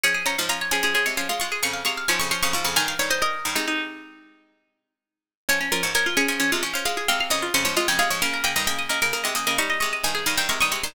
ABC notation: X:1
M:12/8
L:1/16
Q:3/8=88
K:Dblyd
V:1 name="Harpsichord"
d'2 b2 b2 a6 d'2 d'2 d'2 a d' d' d' d' d' | a f d c e16 z4 | d2 B2 B2 A6 f2 g2 e2 c d e g f d | b2 g2 g2 e6 d'2 d'2 a2 f g d' d' d' c' |]
V:2 name="Harpsichord"
A A d f f d A A A d f f2 A f f f f D2 f f f2 | B3 e B3 E E12 z4 | D D F d d F D D D F d f2 A f f d F D2 F d A2 | B B e e e e B B B e e e2 e e e e A e2 B e e2 |]
V:3 name="Harpsichord"
[F,D]2 [F,D] [A,,F,] [F,D]2 [F,D] [F,D] [F,D] [C,A,] [F,D] [A,F] [A,F]2 [F,,D,]2 [C,A,]2 [A,,F,] [F,,D,] [F,D] [F,,D,] [A,,F,] [F,,D,] | [G,,E,]2 [G,,E,]4 [G,,E,] [C,A,]13 z4 | [F,D]2 [F,D] [A,,F,] [F,D]2 [F,D] [F,D] [F,D] [C,A,] [F,D] [F,D] [A,F]2 [C,A,]2 [F,,D,]2 [F,,D,] [A,,F,] [C,A,] [F,,D,] [C,A,] [A,,F,] | [D,B,]2 [D,B,] [G,,E,] [D,B,]2 [D,B,] [D,B,] [D,B,] [C,A,] [D,B,] [D,B,] [G,E]2 [C,A,]2 [G,,E,]2 [G,,E,] [G,,E,] [C,A,] [G,,E,] [C,A,] [G,,E,] |]